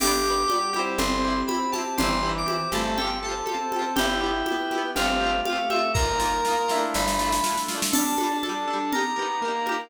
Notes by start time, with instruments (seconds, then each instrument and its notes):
0.00 electric bass (finger) G1, pad 5 (bowed) B3 D4 G4, pizzicato strings D4 G4, lead 2 (sawtooth) G4, electric piano 2 D6, crash, low conga
0.07 pizzicato strings B3
0.24 pizzicato strings D4 G4
0.30 pizzicato strings B3
0.48 pad 5 (bowed) G3 B3 G4, pizzicato strings D4 G4, high conga
0.54 pizzicato strings B3
0.73 pizzicato strings E4 G4, lead 2 (sawtooth) G4, high conga
0.79 pizzicato strings C4
0.98 electric bass (finger) G1, lead 2 (sawtooth) C4, pad 5 (bowed) C4 E4 G4, electric piano 2 C6, low conga
1.24 pizzicato strings E4 G4
1.30 pizzicato strings C4
1.47 pad 5 (bowed) C4 G4 C5, pizzicato strings E4 G4, electric piano 2 B5, high conga
1.54 pizzicato strings C4
1.72 pizzicato strings E4 G4, electric piano 2 A5, snare, high conga
1.78 pizzicato strings C4
1.98 electric bass (finger) G1, lead 2 (sawtooth) E3, pad 5 (bowed) C4 E4 G4, pizzicato strings E4 G4, electric piano 2 C6, low conga
2.03 pizzicato strings C4
2.23 pizzicato strings E4 G4
2.29 pizzicato strings C4
2.38 electric piano 2 D6
2.46 pad 5 (bowed) C4 G4 C5, pizzicato strings E4 G4, high conga
2.52 pizzicato strings C4
2.72 electric bass (finger) G1, lead 2 (sawtooth) A3, pizzicato strings E4 G4, electric piano 2 A5, high conga
2.77 pizzicato strings C4
2.97 pad 5 (bowed) C4 F4 G4 A4, pizzicato strings A4, electric piano 2 G5, low conga
3.01 pizzicato strings F4 G4
3.07 pizzicato strings C4
3.23 pizzicato strings G4 A4, electric piano 2 A5
3.29 pizzicato strings C4 F4
3.46 pad 5 (bowed) C4 F4 A4 C5, pizzicato strings G4 A4, high conga
3.52 pizzicato strings C4 F4
3.72 pizzicato strings A4, high conga
3.76 pizzicato strings F4 G4
3.82 pizzicato strings C4
3.96 electric bass (finger) G1, pad 5 (bowed) B3 E4 G4, lead 2 (sawtooth) E4, pizzicato strings E4 G4, electric piano 2 G5, low conga
4.02 pizzicato strings B3
4.20 lead 2 (sawtooth) E4, pizzicato strings E4 G4
4.26 pizzicato strings B3
4.46 pad 5 (bowed) B3 G4 B4, pizzicato strings E4 G4, high conga
4.52 pizzicato strings B3
4.71 pizzicato strings E4 G4, high conga
4.78 pizzicato strings B3
4.95 electric bass (finger) G1, pad 5 (bowed) A3 C4 F4 G4, lead 2 (sawtooth) C4, pizzicato strings F4 G4, electric piano 2 F5, low conga
5.02 pizzicato strings A3 C4
5.21 pizzicato strings F4 G4
5.27 pizzicato strings A3 C4
5.45 pad 5 (bowed) A3 C4 G4 A4, pizzicato strings G4, electric piano 2 F5, high conga
5.50 pizzicato strings C4 F4
5.56 pizzicato strings A3
5.70 pizzicato strings F4 G4, electric piano 2 E5, high conga
5.76 pizzicato strings A3 C4
5.94 electric bass (finger) G1, pad 5 (bowed) A#3 D#4 F4, pizzicato strings F4, lead 2 (sawtooth) A#4, electric piano 2 A#5, kick, snare
5.99 pizzicato strings A#3 D#4
6.19 pizzicato strings D#4 F4, snare
6.25 pizzicato strings A#3
6.45 pad 5 (bowed) A#3 F4 A#4, pizzicato strings D#4 F4, snare
6.51 pizzicato strings A#3
6.68 pizzicato strings E4 F4, snare
6.74 pizzicato strings A3 D4
6.94 electric bass (finger) G1, pad 5 (bowed) A3 D4 E4 F4, electric piano 2 B5, snare
7.08 snare
7.19 pizzicato strings E4 F4, snare
7.25 pizzicato strings A3 D4
7.32 snare
7.44 pad 5 (bowed) A3 D4 F4 A4, pizzicato strings E4 F4, snare
7.49 pizzicato strings A3 D4
7.57 snare
7.68 pizzicato strings E4 F4, snare
7.75 pizzicato strings A3 D4
7.82 snare
7.92 lead 2 (sawtooth) D4, pizzicato strings D4 A4, pad 5 (bowed) G4 D5 A5, electric piano 2 A5, crash, low conga
7.98 pizzicato strings G3
8.17 pizzicato strings D4 A4, high conga
8.23 pizzicato strings G3
8.31 lead 2 (sawtooth) D4
8.43 pizzicato strings D4 A4, pad 5 (bowed) G4 A4 A5, electric piano 2 A5, high conga
8.49 pizzicato strings G3
8.67 lead 2 (sawtooth) D4, pizzicato strings D4 A4
8.73 pizzicato strings G3
8.92 pad 5 (bowed) D#4 G4 A#5, pizzicato strings G4 A#4, electric piano 2 A#5, low conga
8.98 pizzicato strings D#4
9.16 lead 2 (sawtooth) B3, pizzicato strings G4 A#4
9.22 pizzicato strings D#4
9.41 lead 2 (sawtooth) A#3, pad 5 (bowed) D#4 A#4 A#5, pizzicato strings G4 A#4
9.48 pizzicato strings D#4
9.66 pizzicato strings G4 A#4, high conga
9.72 pizzicato strings D#4